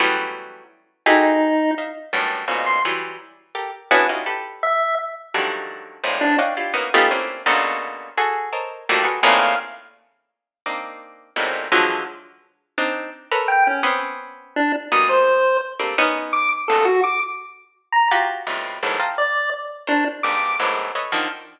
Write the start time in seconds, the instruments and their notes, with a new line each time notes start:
0.00 harpsichord E3 F#3 G3 A3 B3 C#4
1.06 harpsichord D#4 E4 F#4 G4 G#4 A4, lead 1 (square) D#4
1.78 harpsichord D#5 E5 F5
2.13 harpsichord F#2 G2 A2
2.48 harpsichord G#2 A#2 B2 C#3
2.66 lead 1 (square) C6
2.85 harpsichord E3 F#3 G3
3.55 harpsichord G4 A4 A#4
3.91 harpsichord B3 C#4 D4 E4 F#4 G#4
4.09 harpsichord C#4 D#4 E4 F4 F#4 G4
4.26 harpsichord G4 A4 B4
4.63 lead 1 (square) E5
5.34 harpsichord D3 D#3 F3 F#3 G3 A3
6.04 harpsichord G#2 A2 A#2 C3
6.21 lead 1 (square) D4
6.39 harpsichord C#5 D5 D#5 F5 F#5 G5
6.57 harpsichord E4 F4 G4
6.74 harpsichord A#3 B3 C#4 D#4 E4 F#4
6.94 harpsichord A3 B3 C#4 D#4 F4 G4
7.11 harpsichord A3 A#3 C4 C#4 D4 E4
7.46 harpsichord A#2 B2 C#3 D3
8.17 harpsichord F#4 G#4 A4
8.53 harpsichord A4 A#4 C5 C#5 D#5
8.89 harpsichord D#3 F3 F#3 G3 A3 A#3
9.04 harpsichord F#4 G#4 A4 B4
9.23 harpsichord A2 A#2 C3 C#3 D#3, lead 1 (square) F5
10.66 harpsichord A#3 C4 D4 D#4
11.36 harpsichord G#2 A2 A#2 B2 C3
11.72 harpsichord D3 E3 F3 F#3 G#3
12.78 harpsichord C4 D4 D#4
13.32 harpsichord A4 A#4 B4 C#5
13.48 lead 1 (square) G5
13.67 lead 1 (square) C#4
13.83 harpsichord B3 C4 C#4
14.56 lead 1 (square) D4
14.92 harpsichord F#3 G3 G#3 A#3 B3, lead 1 (square) D#6
15.09 lead 1 (square) C5
15.80 harpsichord G3 A3 A#3 C4 D4
15.98 harpsichord B3 C#4 D#4
16.33 lead 1 (square) D6
16.68 harpsichord G2 G#2 A#2 B2 C#3, lead 1 (square) A4
16.85 lead 1 (square) F#4
17.04 lead 1 (square) D6
17.92 lead 1 (square) A#5
18.11 harpsichord F4 F#4 G4
18.47 harpsichord F2 G2 A2 B2 C3
18.83 harpsichord E2 F#2 G#2 A2
19.00 harpsichord D#5 F5 G5 A5 A#5 C6
19.18 lead 1 (square) D5
19.87 lead 1 (square) D4, harpsichord A#4 C5 C#5
20.23 harpsichord F2 G2 G#2 A#2, lead 1 (square) D6
20.60 harpsichord E2 F#2 G#2 A2
20.95 harpsichord A4 B4 C#5 D#5 E5
21.12 harpsichord D3 D#3 F3